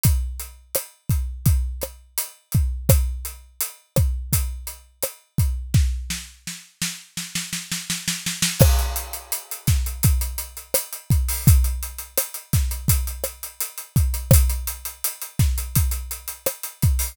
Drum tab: CC |----------------|----------------|----------------|x---------------|
HH |x-x-x-x-x-x-x-x-|x-x-x-x-x-x-x-x-|----------------|-xxxxxxxxxxxxxxo|
SD |----r-----r-----|r-----r-----r---|o-o-o-o-oooooooo|r-----o-----r---|
BD |o-----o-o-----o-|o-----o-o-----o-|o---------------|o-----o-o-----o-|

CC |----------------|----------------|
HH |xxxxxxxxxxxxxxxx|xxxxxxxxxxxxxxxo|
SD |----r-o---r-----|r-----o-----r---|
BD |o-----o-o-----o-|o-----o-o-----o-|